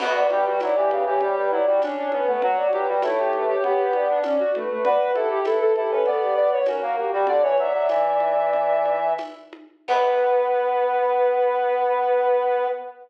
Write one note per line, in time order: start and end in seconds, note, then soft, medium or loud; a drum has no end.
0.00 0.27 B3 medium
0.00 0.29 F#4 loud
0.00 0.16 F#5 medium
0.00 crash loud
0.00 low conga loud
0.14 0.29 D5 medium
0.30 0.45 G3 medium
0.30 0.45 G4 medium
0.30 0.60 B4 medium
0.30 high conga loud
0.46 0.60 G3 medium
0.46 0.61 F#4 medium
0.60 0.75 F#3 medium
0.60 0.74 E4 medium
0.60 0.89 D5 medium
0.60 tambourine medium
0.60 high conga loud
0.75 0.91 E3 medium
0.75 1.03 G4 medium
0.90 1.05 C#3 medium
0.90 1.05 B4 medium
0.90 high conga medium
1.06 1.20 E3 medium
1.06 1.20 G4 medium
1.06 1.20 C#5 medium
1.20 1.36 G3 medium
1.20 1.48 G4 medium
1.20 1.35 C#5 medium
1.20 low conga medium
1.37 1.51 G3 medium
1.37 1.52 B4 loud
1.51 1.66 F#3 medium
1.51 1.65 E4 medium
1.51 1.81 D5 loud
1.67 1.81 G3 medium
1.67 1.81 F#4 medium
1.82 2.08 C#4 medium
1.82 1.97 D4 loud
1.82 2.08 C#5 medium
1.82 tambourine loud
1.82 high conga loud
1.97 2.12 D4 loud
2.12 2.27 B3 loud
2.12 2.27 C#4 medium
2.12 2.26 B4 loud
2.12 high conga medium
2.27 2.42 A3 medium
2.27 2.42 B3 medium
2.27 2.41 B4 medium
2.42 2.67 F#3 medium
2.42 2.69 F#4 loud
2.42 2.56 F#5 loud
2.42 low conga loud
2.56 2.71 D5 medium
2.72 2.87 F#3 medium
2.72 2.87 G4 medium
2.72 3.02 B4 medium
2.72 high conga medium
2.88 3.03 G3 medium
2.88 3.03 F#4 medium
3.02 3.56 A3 medium
3.02 3.18 E4 loud
3.02 3.28 C#5 loud
3.02 tambourine loud
3.02 high conga loud
3.18 3.45 G4 medium
3.33 3.48 B4 medium
3.33 high conga medium
3.47 3.63 G4 loud
3.47 3.62 C#5 medium
3.63 4.19 B3 medium
3.63 3.93 G4 medium
3.63 3.79 C#5 medium
3.63 low conga medium
3.78 3.92 B4 medium
3.93 4.09 G4 medium
3.93 4.21 D5 medium
3.93 high conga medium
4.10 4.24 D4 loud
4.23 4.38 C#4 medium
4.23 4.51 D5 medium
4.23 tambourine medium
4.23 high conga loud
4.39 4.54 F#4 loud
4.55 4.69 A3 medium
4.55 4.69 B4 medium
4.55 high conga medium
4.70 4.84 A3 medium
4.70 4.84 B4 loud
4.84 5.13 F#4 medium
4.84 5.11 B4 loud
4.84 4.98 D5 loud
4.84 low conga loud
5.01 5.15 B4 medium
5.14 5.40 E4 medium
5.14 5.39 G4 medium
5.14 5.29 A4 loud
5.14 high conga medium
5.30 5.45 G4 medium
5.45 5.73 E4 medium
5.45 5.60 A4 medium
5.45 5.74 B4 medium
5.45 tambourine medium
5.45 high conga loud
5.61 5.75 A4 medium
5.76 5.91 E4 medium
5.76 5.91 G4 medium
5.76 5.91 A4 medium
5.76 high conga medium
5.89 6.06 C#4 medium
5.89 6.03 A4 medium
5.89 6.06 B4 medium
6.05 6.58 B3 medium
6.05 6.21 A4 medium
6.05 6.35 D5 medium
6.05 low conga medium
6.19 6.33 G4 medium
6.35 6.60 B4 medium
6.35 6.50 D5 loud
6.52 6.66 C#5 medium
6.66 6.82 C#4 medium
6.66 7.08 F#4 medium
6.66 6.93 A#4 medium
6.66 tambourine medium
6.66 high conga loud
6.82 6.96 A#3 medium
6.97 7.11 A#3 medium
6.97 7.11 G4 medium
7.12 7.27 G3 medium
7.12 7.27 F#4 medium
7.12 7.27 G4 loud
7.27 7.42 D3 medium
7.27 7.42 D5 loud
7.27 low conga loud
7.42 7.57 E3 medium
7.42 7.56 B4 medium
7.42 7.57 C#5 loud
7.58 7.73 F#3 medium
7.58 8.96 D5 medium
7.58 9.11 E5 medium
7.58 high conga medium
7.74 7.88 F#3 medium
7.89 9.14 E3 medium
7.89 tambourine medium
7.89 high conga medium
8.20 high conga medium
8.53 low conga medium
8.86 high conga medium
9.18 tambourine medium
9.18 high conga loud
9.53 high conga medium
9.88 12.67 B3 loud
9.88 12.68 B4 loud
9.88 kick loud
9.88 crash loud